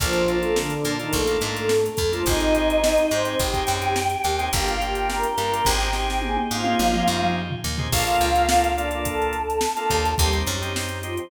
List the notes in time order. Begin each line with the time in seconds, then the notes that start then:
0.00 A#1 F3 A#3 D4 F4 A4, kick, closed hi-hat
0.13 closed hi-hat
0.28 A#3 D4 F4 A4, closed hi-hat
0.42 A3 A4, closed hi-hat
0.56 D3 D4, snare
0.70 closed hi-hat
0.85 A#2 A#3 D4 F4 A4, closed hi-hat
0.99 D#3 A#3 D4 D#4 F4 A4, closed hi-hat
1.13 A#1 A3 A4, kick, closed hi-hat
1.27 A#3 D4 F4 A4, closed hi-hat
1.41 G#2 A3 A4, closed hi-hat
1.56 closed hi-hat
1.69 snare
1.86 closed hi-hat
1.97 F2, kick, closed hi-hat
2.12 F3 A#3 D4 F4 A4, closed hi-hat
2.26 G#1 C4 D#4 G4 G#4 D#5, kick, closed hi-hat
2.40 closed hi-hat
2.55 C4 D#4 G4 G#4, closed hi-hat
2.70 closed hi-hat
2.84 snare
2.98 closed hi-hat
3.11 G#2 C4 D#4 G4 G#4 C5, closed hi-hat
3.25 C4 D#4 G4 G#4, closed hi-hat
3.39 G#1 G4 G5, kick, closed hi-hat
3.53 C4 D#4 G4 G#4, kick, closed hi-hat
3.67 F#2, closed hi-hat
3.82 closed hi-hat
3.96 snare
4.10 closed hi-hat
4.24 D#2, closed hi-hat
4.39 C4 D#4 G4 G#4, closed hi-hat
4.53 G1 A#3 D4 F4 G4 G5, kick, closed hi-hat
4.67 F4 F5, closed hi-hat
4.81 A#3 D4 F4 G4 G5, closed hi-hat
4.95 closed hi-hat
5.10 A#4 A#5, snare
5.23 A#4 A#5, closed hi-hat
5.38 G2 A#3 D4 F4 G4 A#4 A#5, closed hi-hat
5.52 A#3 D4 F4 G4, closed hi-hat
5.65 G#1 C4 D#4 G4 G#4 G5, kick, snare
5.80 G4 G5, snare
5.93 C4 D#4 G4 G#4 G5, snare
6.10 snare
6.22 G#4 G#5, high tom
6.37 high tom
6.51 G#2 C4 D#4 F4 G4 G#4 F5
6.64 C4 D#4 G4 G#4, high tom
6.79 G#1, mid tom
6.93 C4 D#4 G4 G#4, mid tom
7.07 F#2, mid tom
7.22 mid tom
7.50 floor tom
7.64 D#2
7.78 C4 D#4 G4 G#4, floor tom
7.92 A#1 A#3 D4 F4 A4 F5, kick, crash
8.07 A#3 D4 F4 A4, closed hi-hat
8.21 C#2, closed hi-hat
8.35 A#3 D4 F4 A4, closed hi-hat
8.49 A#3 D4 F4 A4, snare
8.64 closed hi-hat
8.76 A#3 D4 F4 A4 D5, closed hi-hat
8.91 A#3 D4 F4 A4, closed hi-hat
9.04 A4 A5, kick, closed hi-hat
9.22 closed hi-hat
9.33 closed hi-hat
9.50 closed hi-hat
9.61 snare
9.77 A#3 D4 F4 A4, closed hi-hat
9.90 D#2, kick, closed hi-hat
10.05 closed hi-hat
10.17 D#2 G3 C4 D#4 G4, kick, closed hi-hat
10.33 C4 D#4 G4, closed hi-hat
10.46 F#2, closed hi-hat
10.62 C4 D#4 G4, closed hi-hat
10.76 C4 D#4 G4, snare
10.89 closed hi-hat
11.03 F3 C4 D#4 F4 G4, closed hi-hat
11.17 C4 D#4 G4, closed hi-hat